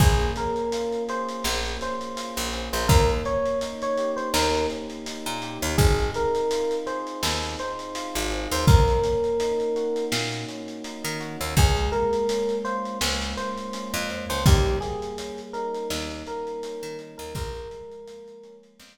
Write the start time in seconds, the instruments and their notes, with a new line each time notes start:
0.00 electric bass (finger) A#1, electric piano 1 A#3 G#4, kick, crash
0.20 snare, closed hi-hat
0.36 electric piano 1 C#4 A#4, closed hi-hat
0.56 closed hi-hat
0.72 electric piano 1 F4, closed hi-hat
0.92 closed hi-hat
1.08 electric piano 1 G#4 C5, closed hi-hat
1.29 closed hi-hat
1.44 electric bass (finger) A#1, electric piano 1 A#3, snare
1.65 snare, closed hi-hat
1.81 electric piano 1 C#4 C5, snare, closed hi-hat
2.01 closed hi-hat
2.16 electric piano 1 F4, closed hi-hat
2.37 electric bass (finger) A#1, closed hi-hat
2.53 electric piano 1 G#4, closed hi-hat
2.73 electric bass (finger) A#1, electric piano 1 C5, closed hi-hat
2.88 electric bass (finger) D#2, electric piano 1 A#3 A#4, kick, closed hi-hat
3.10 closed hi-hat
3.25 electric piano 1 C#4 C#5, closed hi-hat
3.45 closed hi-hat
3.61 electric piano 1 D#4, closed hi-hat
3.82 electric piano 1 C#5, closed hi-hat
3.97 electric piano 1 G4, closed hi-hat
4.17 electric piano 1 C5, closed hi-hat
4.34 electric bass (finger) D#2, electric piano 1 A#3 A#4, snare
4.54 snare, closed hi-hat
4.70 electric piano 1 C#4, closed hi-hat
4.90 closed hi-hat
5.06 electric piano 1 D#4, closed hi-hat
5.26 electric bass (finger) A#2, closed hi-hat
5.42 electric piano 1 G4, closed hi-hat
5.62 electric bass (finger) D#2, closed hi-hat
5.78 electric bass (finger) G#1, electric piano 1 C4 G#4, kick, closed hi-hat
5.99 closed hi-hat
6.14 electric piano 1 D#4 A#4, closed hi-hat
6.35 closed hi-hat
6.51 electric piano 1 F4, closed hi-hat
6.71 closed hi-hat
6.86 electric piano 1 G#4 C5, closed hi-hat
7.07 closed hi-hat
7.23 electric bass (finger) D#2, electric piano 1 C4, snare
7.43 snare, closed hi-hat
7.59 electric piano 1 D#4 C5, closed hi-hat
7.79 closed hi-hat
7.95 electric piano 1 F4, closed hi-hat
8.15 electric bass (finger) G#1, closed hi-hat
8.31 electric piano 1 G#4, closed hi-hat
8.52 electric bass (finger) D#2, electric piano 1 C5, closed hi-hat
8.67 electric bass (finger) D#2, electric piano 1 A#3 A#4, kick, closed hi-hat
8.88 closed hi-hat
9.04 electric piano 1 C#4, closed hi-hat
9.24 closed hi-hat
9.40 electric piano 1 D#4, closed hi-hat
9.60 closed hi-hat
9.76 electric piano 1 F#4, closed hi-hat
9.96 closed hi-hat
10.12 electric bass (finger) A#2, electric piano 1 A#3, snare
10.32 snare, closed hi-hat
10.48 electric piano 1 C#4, closed hi-hat
10.68 closed hi-hat
10.84 electric piano 1 D#4, closed hi-hat
11.05 electric bass (finger) D#3, closed hi-hat
11.20 electric piano 1 F#4, closed hi-hat
11.41 electric bass (finger) D#2, closed hi-hat
11.57 electric bass (finger) C#2, electric piano 1 G#3 G#4, kick, closed hi-hat
11.77 closed hi-hat
11.92 electric piano 1 A#3 A#4, closed hi-hat
12.13 closed hi-hat
12.29 electric piano 1 C#4, closed hi-hat
12.49 closed hi-hat
12.65 electric piano 1 F4 C5, closed hi-hat
12.85 closed hi-hat
13.01 electric bass (finger) C#2, electric piano 1 G#3, snare
13.21 snare, closed hi-hat
13.37 electric piano 1 A#3 C5, closed hi-hat
13.58 closed hi-hat
13.73 electric piano 1 C#4, closed hi-hat
13.94 electric bass (finger) F2, closed hi-hat
14.09 electric piano 1 F4, closed hi-hat
14.30 electric bass (finger) C#2, electric piano 1 C5, closed hi-hat
14.46 electric bass (finger) D#2, electric piano 1 G3 G4, kick, closed hi-hat
14.66 closed hi-hat
14.81 electric piano 1 A#3 G#4, snare, closed hi-hat
15.02 closed hi-hat
15.18 electric piano 1 C#4, closed hi-hat
15.38 closed hi-hat
15.53 electric piano 1 D#4 A#4, closed hi-hat
15.74 closed hi-hat
15.90 electric bass (finger) D#2, electric piano 1 G3, snare
16.11 snare, closed hi-hat
16.26 electric piano 1 A#3 A#4, closed hi-hat
16.47 closed hi-hat
16.63 electric piano 1 C#4, closed hi-hat
16.83 electric bass (finger) D#3, closed hi-hat
16.99 electric piano 1 D#4, closed hi-hat
17.18 electric bass (finger) D#2, electric piano 1 A#4, closed hi-hat
17.35 electric bass (finger) A#1, electric piano 1 F3 A#4, kick, closed hi-hat
17.55 closed hi-hat
17.70 electric piano 1 G#3, closed hi-hat
17.91 closed hi-hat
18.07 electric piano 1 A#3, closed hi-hat
18.28 closed hi-hat
18.43 electric piano 1 C#4, closed hi-hat
18.63 closed hi-hat
18.80 electric bass (finger) F2, electric piano 1 F3, snare